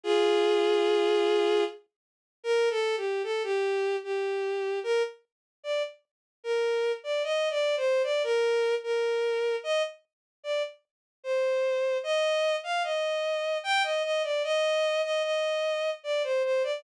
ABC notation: X:1
M:3/4
L:1/16
Q:1/4=75
K:Eb
V:1 name="Violin"
[FA]10 z2 | [K:Bb] (3B2 A2 G2 A G3 G4 | B z3 d z3 B3 d | (3e2 d2 c2 d B3 B4 |
e z3 d z3 c4 | [K:Eb] e3 f e4 g e e d | e3 e e4 d c c d |]